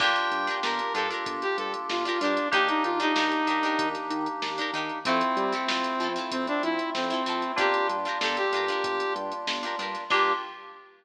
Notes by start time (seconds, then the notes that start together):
0.00 G1 A#3 D4 F4 G4 A#4 G5, kick, crash
0.16 closed hi-hat
0.31 G2, closed hi-hat
0.47 D4 F4 G4 A#4, snare, closed hi-hat
0.63 G1 D4 F4 G4 A#4, snare
0.79 closed hi-hat
0.94 G2 D4 F4 G4 A4 A#4, closed hi-hat
1.10 D4 F4 G4 A#4, closed hi-hat
1.26 G1, kick, closed hi-hat
1.42 G4, snare, closed hi-hat
1.58 G2 A4, snare, closed hi-hat
1.74 closed hi-hat
1.89 G1 F4, snare
2.05 D4 F4 G4 A#4, snare, closed hi-hat
2.20 G2 D4 F4 G4, closed hi-hat
2.25 A#4
2.37 closed hi-hat
2.51 D#2 A#3 D4 D#4 G4, kick, closed hi-hat
2.56 A#4
2.68 D#4, closed hi-hat
2.84 D#3 F4, closed hi-hat
3.00 D4 D#4 G4 A#4, closed hi-hat
3.16 D#2 D4 D#4 G4, snare
3.20 A#4
3.32 closed hi-hat
3.47 D#3 D4 D#4 G4 A#4, closed hi-hat
3.63 D4 D#4 G4 A#4, closed hi-hat
3.79 D#2, kick, closed hi-hat
3.95 snare, closed hi-hat
4.10 D#3, closed hi-hat
4.26 closed hi-hat
4.42 D#2, snare
4.58 D4 D#4 G4 A#4, closed hi-hat
4.73 D#3 D4 D#4 G4 A#4, snare, closed hi-hat
4.89 closed hi-hat
5.05 F2 A3 C4 E4 F4 A4, kick, closed hi-hat
5.21 closed hi-hat
5.37 G3, closed hi-hat
5.52 C4 E4 F4 A4, closed hi-hat
5.68 F2 C4 E4 F4 A4, snare
5.84 snare, closed hi-hat
6.00 F3 C4 E4 F4, closed hi-hat
6.04 A4
6.16 C4 E4 F4 A4, closed hi-hat
6.31 F2 C4, kick, closed hi-hat
6.47 D4, closed hi-hat
6.63 F3 E4, closed hi-hat
6.79 closed hi-hat
6.94 F2 C4, snare
7.10 C4 E4 F4 A4, closed hi-hat
7.26 F3 C4 E4 F4 A4, closed hi-hat
7.42 closed hi-hat
7.56 G1 G3 A#3 D4 F4 G4, kick, closed hi-hat
7.61 A#4
7.74 closed hi-hat
7.89 G2, closed hi-hat
8.05 D4 F4 G4 A#4, closed hi-hat
8.21 G1 D4 F4 G4 A4, snare
8.25 A#4
8.37 G4, snare, closed hi-hat
8.52 G2 D4 F4 G4, closed hi-hat
8.57 A#4
8.68 D4 F4 G4 A#4, closed hi-hat
8.84 G1, kick, closed hi-hat
9.00 closed hi-hat
9.16 G2, closed hi-hat
9.32 closed hi-hat
9.47 G1, snare
9.63 D4 F4 G4 A#4, closed hi-hat
9.79 G2 D4 F4 G4 A#4, closed hi-hat
9.95 snare, closed hi-hat
10.10 G2 A#3 D4 F4 G4 A#4, kick, crash